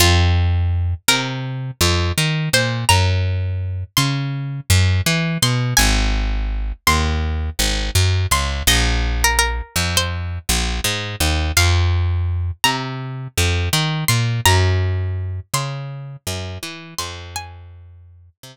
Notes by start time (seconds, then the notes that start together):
0.00 F2 F4
1.08 C3 A#4
1.81 F2
2.18 D#3
2.53 A#2 C5
2.89 F#2 A#5
3.97 C#3 C6
4.70 F#2
5.06 E3
5.42 B2 C6
5.77 G#1 G#5
6.87 D#2 C6
7.59 G#1
7.95 F#2
8.31 C#2 C6
8.67 A#1 D#5
9.24 A#4
9.39 A#4
9.76 F2
9.97 C5
10.49 A#1
10.84 G#2
11.20 D#2
11.57 F2 F5
12.64 C3 A#5
13.38 F2
13.73 D#3
14.08 A#2 C6
14.45 F#2 A#5
15.54 C#3 C6
16.27 F#2
16.63 E3
16.98 F2 C6
17.36 G#5
18.43 C3